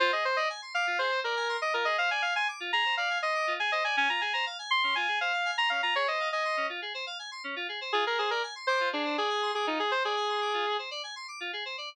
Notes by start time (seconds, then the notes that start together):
0.00 F4 C5
0.12 G#4 D#5
0.25 C5
0.36 D5 D#5
0.50 G#5
0.62 C6
0.74 F5 D6
0.87 F4
0.99 G#4 C5
1.12 C5
1.24 A#4 D5
1.36 G#5
1.49 C6
1.61 D#5 D6
1.74 F4 A#4
1.85 G#4 D#5
1.98 C5 F5
2.11 D5 G#5
2.22 F5 G#5
2.36 G#5 C6
2.48 D6
2.60 F4
2.73 G#4 A#5
2.85 C5
2.97 D5 F5
3.10 G#5
3.22 D#5 C6
3.35 D6
3.47 F4
3.59 G#4 G#5
3.72 C5 D#5
3.84 D5 G#5
3.97 C#4 G#5
4.09 F4 A#5
4.21 G#4 G#5
4.33 C5 A#5
4.46 F5
4.59 G#5
4.71 C6
4.83 C#4
4.95 F4 G#5
5.08 G#4
5.21 C5 F5
5.33 F5
5.45 G#5
5.58 A#5 C6
5.70 C#4 F5
5.83 F4 A#5
5.95 G#4 C#5
6.07 C5 D#5
6.20 F5
6.32 D#5 G#5
6.45 C6
6.57 C#4
6.69 F4
6.82 G#4
6.94 C5
7.07 F5
7.19 G#5
7.31 C6
7.44 C#4
7.56 F4
7.69 G#4
7.81 C5
7.93 F4 G#4
8.06 G#4 A#4
8.18 G#4 C5
8.31 A#4 D5
8.43 G#5
8.55 C6
8.67 C5 D6
8.80 F4
8.92 D4 G#4
9.05 C5
9.17 G#4 D5
9.30 G#5
9.42 C6
9.55 G#4 D6
9.67 D#4 F4
9.79 G#4
9.91 C5
10.04 G#4 D5
10.16 G#5
10.29 C6
10.41 D6
10.54 F4
10.66 G#4
10.79 C5
10.91 D5
11.03 G#5
11.16 C6
11.28 D6
11.40 F4
11.53 G#4
11.65 C5
11.78 D5